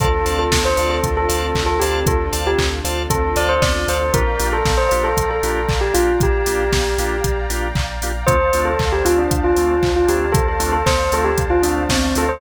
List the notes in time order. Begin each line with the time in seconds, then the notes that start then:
0.00 D2 C4 D4 F4 A4 C5 D5 F5 A5, kick, closed hi-hat
0.26 D2 C5 D5 F5 A5, open hi-hat
0.39 A4
0.52 D2, kick, snare
0.65 C5
0.77 D2 C5 D5 F5 A5, open hi-hat
0.90 A4
1.03 D2, kick, closed hi-hat
1.17 A4
1.29 D2 C5 D5 F5 A5, open hi-hat
1.55 D2, kick, clap
1.66 A4
1.80 D2 G4 C5 D5 F5 A5, open hi-hat
2.06 D2 A4, kick, closed hi-hat
2.32 D2 C5 D5 F5 A5, open hi-hat
2.47 G4
2.59 D2, kick, clap
2.84 D2 C5 D5 F5 A5, open hi-hat
3.10 D2 A4, kick, closed hi-hat
3.36 D2 C5 D5 F5 A5, open hi-hat
3.49 C5
3.62 D2 D5, kick, snare
3.88 D2 C5 D5 F5 A5, open hi-hat
4.13 A#1 A#3 D4 F4 G4 A#4 D5 F5 G5 A#5, kick, closed hi-hat
4.39 A#1 A#3 D4 F4 G4, open hi-hat
4.53 A4
4.65 A#1, kick, snare
4.77 C5
4.89 A#1 A#3 D4 F4 G4 C5, open hi-hat
5.04 A4
5.17 A#1, kick, closed hi-hat
5.31 A4
5.43 A#1 A#3 D4 F4 G4, open hi-hat
5.69 A#1, kick, clap
5.81 G4
5.94 A#1 A#3 D4 F4 G4, open hi-hat
6.20 A#1 G4, kick, closed hi-hat
6.46 A#1 A#3 D4 F4 G4, open hi-hat
6.72 A#1, kick, snare
6.98 A#1 A#3 D4 F4 G4, open hi-hat
7.24 A#1, kick, closed hi-hat
7.50 A#1 A#3 D4 F4 G4, open hi-hat
7.75 A#1, kick, clap
8.02 A#1 A#3 D4 F4 G4, open hi-hat
8.27 D2 A3 C4 D4 F4 C5 D5 F5 A5, kick, closed hi-hat
8.53 D2 A3 C4 D4 F4, open hi-hat
8.65 A4
8.79 D2, kick, clap
8.92 G4
9.05 D2 A3 C4 D4 F4, open hi-hat
9.18 D4
9.31 D2, kick, closed hi-hat
9.44 F4
9.56 D2 A3 C4 D4 F4, open hi-hat
9.83 D2, kick, clap
9.96 F4
10.08 D2 A3 C4 D4 F4 G4, open hi-hat
10.32 D2 A4, kick, closed hi-hat
10.48 A4
10.59 D2 A3 C4 D4 F4, open hi-hat
10.73 A4
10.86 D2 C5, kick, snare
11.12 D2 A3 C4 D4 F4 A4, open hi-hat
11.24 G4
11.38 D2, kick, closed hi-hat
11.50 F4
11.62 D2 A3 C4 D4 F4, open hi-hat
11.89 D2 C4, kick, snare
12.15 D2 A3 C4 D4 F4 A4, open hi-hat
12.29 C5